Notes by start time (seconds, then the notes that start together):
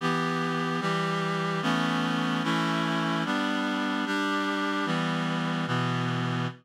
0.00 E3 B3 G4
0.81 E3 G3 G4
1.62 E3 A3 B3 C#4
2.43 E3 A3 C#4 E4
3.25 G3 B3 D4
4.06 G3 D4 G4
4.85 E3 G3 B3
5.67 B2 E3 B3